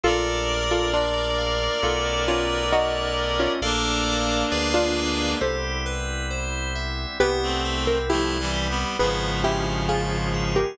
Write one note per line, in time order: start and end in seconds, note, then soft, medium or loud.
0.04 1.69 A#1 loud
0.04 1.81 A3 medium
0.04 1.81 A#3 medium
0.04 1.81 D4 medium
0.04 1.81 F4 medium
0.04 0.62 F4 loud
0.04 0.44 A4 loud
0.04 0.62 A4 loud
0.04 3.52 A#4 medium
0.04 3.52 D5 loud
0.49 0.89 A#4 loud
0.71 0.92 F4 medium
0.71 0.92 A4 loud
0.93 1.67 D4 medium
0.93 1.67 F4 loud
0.93 1.34 D5 medium
1.38 1.78 F5 medium
1.82 3.48 B1 loud
1.82 3.60 A3 medium
1.82 3.60 B3 medium
1.82 3.60 C#4 medium
1.82 3.60 D#4 medium
1.82 2.24 F4 medium
1.82 2.24 A4 loud
2.28 2.64 C#4 medium
2.28 2.64 F4 loud
2.28 2.68 B4 medium
2.72 3.29 D#4 loud
2.72 3.29 F#4 loud
2.72 3.13 C#5 medium
3.16 3.57 D#5 medium
3.40 3.61 C#4 medium
3.40 3.61 F4 loud
3.62 4.44 A#1 loud
3.62 4.51 A3 medium
3.62 4.51 A#3 medium
3.62 5.38 A#3 medium
3.62 4.51 D4 medium
3.62 5.38 D4 loud
3.62 4.51 F4 medium
3.62 4.43 A4 loud
3.62 4.43 A#4 loud
3.62 4.43 D5 loud
3.62 4.43 F5 loud
4.51 5.35 D2 loud
4.51 5.40 G#3 medium
4.51 5.40 B3 medium
4.51 5.40 D4 medium
4.51 5.40 F4 medium
4.51 5.32 G#4 loud
4.51 5.32 B4 loud
4.51 5.32 D5 loud
4.51 5.32 F5 loud
4.74 5.29 D4 loud
4.74 5.29 F4 loud
5.41 7.06 C2 medium
5.41 7.18 G3 medium
5.41 7.18 B3 medium
5.41 7.18 C4 medium
5.41 7.18 E4 medium
5.41 5.81 G4 loud
5.41 6.23 A4 medium
5.41 6.23 C5 medium
5.86 6.26 B4 medium
6.30 6.71 C5 medium
6.75 7.16 E5 medium
7.20 8.85 C2 loud
7.20 8.97 G3 medium
7.20 8.97 B3 medium
7.20 7.60 B3 loud
7.20 8.97 C4 medium
7.20 8.97 E4 medium
7.20 7.77 G4 loud
7.20 7.77 B4 loud
7.43 7.99 A3 medium
7.43 7.99 C4 medium
7.65 8.05 C4 medium
7.87 8.08 A#4 loud
8.09 8.38 F3 medium
8.09 8.38 A3 medium
8.09 8.50 E4 medium
8.09 8.90 E4 medium
8.09 8.90 G4 loud
8.39 8.68 E3 medium
8.39 8.68 G3 medium
8.54 8.95 G4 medium
8.69 8.97 G3 medium
8.69 8.97 B3 medium
8.99 10.65 G#1 loud
8.99 10.60 C#3 medium
8.99 10.60 F3 medium
8.99 10.77 G#3 medium
8.99 9.40 B3 loud
8.99 10.77 B3 medium
8.99 10.77 C#4 medium
8.99 10.77 F4 medium
8.99 9.39 G#4 medium
8.99 9.39 B4 medium
9.44 9.84 C#4 medium
9.44 9.88 E4 medium
9.44 9.88 G4 loud
9.89 10.29 F4 medium
9.89 10.44 F4 medium
9.89 10.44 G#4 loud
10.34 10.74 G#4 medium
10.56 10.77 G4 loud
10.56 10.77 A#4 loud